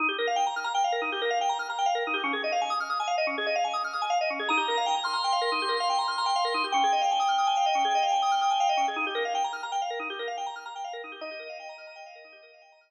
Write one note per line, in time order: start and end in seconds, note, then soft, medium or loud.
0.00 0.07 D#4 loud
0.09 0.17 G4 medium
0.18 0.27 A#4 medium
0.27 0.36 F5 medium
0.36 0.44 G5 loud
0.47 0.55 A#5 medium
0.56 0.65 F6 loud
0.64 0.73 A#5 medium
0.74 0.83 G5 loud
0.84 0.93 F5 loud
0.92 1.01 A#4 medium
1.02 1.10 D#4 medium
1.12 1.21 G4 medium
1.22 1.30 A#4 medium
1.30 1.39 F5 loud
1.41 1.49 G5 medium
1.49 1.58 A#5 loud
1.59 1.68 F6 medium
1.70 1.78 A#5 medium
1.79 1.87 G5 medium
1.86 1.94 F5 loud
1.95 2.03 A#4 medium
2.07 2.15 D#4 medium
2.14 2.22 G4 medium
2.24 2.32 C#4 loud
2.33 2.42 G#4 medium
2.44 2.52 D#5 medium
2.52 2.61 F5 loud
2.61 2.70 G#5 medium
2.70 2.78 D#6 loud
2.80 2.89 F6 medium
2.90 2.98 D#6 medium
3.00 3.08 G#5 loud
3.07 3.16 F5 medium
3.18 3.26 D#5 loud
3.27 3.35 C#4 medium
3.38 3.46 G#4 loud
3.46 3.55 D#5 medium
3.56 3.64 F5 loud
3.64 3.73 G#5 medium
3.73 3.82 D#6 medium
3.84 3.93 F6 medium
3.93 4.02 D#6 medium
4.02 4.10 G#5 medium
4.10 4.18 F5 loud
4.21 4.29 D#5 loud
4.30 4.39 C#4 medium
4.39 4.48 G#4 medium
4.49 4.58 D#4 loud
4.49 5.03 A#5 medium
4.57 4.66 G4 medium
4.68 4.76 A#4 medium
4.77 4.86 F5 medium
4.86 4.94 G5 medium
4.95 5.04 A#5 medium
5.04 6.65 C6 medium
5.04 5.12 F6 medium
5.13 5.22 A#5 loud
5.24 5.33 G5 medium
5.33 5.41 F5 medium
5.41 5.50 A#4 loud
5.52 5.60 D#4 medium
5.62 5.70 G4 medium
5.69 5.77 A#4 medium
5.80 5.89 F5 medium
5.90 5.98 G5 loud
5.99 6.07 A#5 medium
6.08 6.16 F6 medium
6.18 6.26 A#5 medium
6.26 6.34 G5 medium
6.36 6.44 F5 loud
6.45 6.53 A#4 medium
6.54 6.63 D#4 medium
6.64 6.73 G4 medium
6.72 6.82 C#4 loud
6.72 8.86 G5 medium
6.84 6.92 G#4 medium
6.92 7.01 D#5 medium
7.01 7.10 F5 medium
7.11 7.20 G#5 loud
7.20 7.28 D#6 medium
7.28 7.37 F6 medium
7.38 7.47 D#6 medium
7.47 7.55 G#5 loud
7.57 7.65 F5 medium
7.66 7.74 D#5 medium
7.75 7.83 C#4 medium
7.85 7.93 G#4 loud
7.95 8.03 D#5 medium
8.03 8.11 F5 medium
8.12 8.20 G#5 medium
8.22 8.31 D#6 loud
8.31 8.40 F6 medium
8.41 8.50 D#6 medium
8.51 8.59 G#5 loud
8.60 8.68 F5 loud
8.69 8.77 D#5 loud
8.77 8.86 C#4 medium
8.88 8.96 G#4 medium
8.96 9.05 D#4 loud
9.07 9.15 G4 loud
9.15 9.23 A#4 loud
9.25 9.33 F5 medium
9.35 9.43 G5 loud
9.44 9.53 A#5 medium
9.53 9.61 F6 medium
9.63 9.71 A#5 medium
9.72 9.80 G5 loud
9.82 9.90 F5 medium
9.90 9.99 A#4 medium
9.99 10.08 D#4 medium
10.10 10.18 G4 loud
10.19 10.27 A#4 medium
10.28 10.36 F5 medium
10.37 10.46 G5 medium
10.46 10.55 A#5 loud
10.56 10.64 F6 medium
10.66 10.74 A#5 medium
10.76 10.84 G5 medium
10.84 10.93 F5 loud
10.93 11.02 A#4 loud
11.04 11.12 D#4 medium
11.12 11.20 G4 medium
11.21 11.30 D#4 loud
11.21 12.90 D#5 medium
11.31 11.39 G4 medium
11.39 11.48 A#4 medium
11.49 11.58 F5 medium
11.60 11.68 G5 loud
11.69 11.77 A#5 loud
11.78 11.86 F6 medium
11.87 11.95 A#5 medium
11.96 12.04 G5 loud
12.06 12.15 F5 loud
12.15 12.24 A#4 medium
12.24 12.33 D#4 medium
12.32 12.41 G4 medium
12.43 12.51 A#4 medium
12.54 12.62 F5 medium
12.62 12.70 G5 loud
12.72 12.81 A#5 medium
12.81 12.89 F6 loud
12.89 12.90 A#5 loud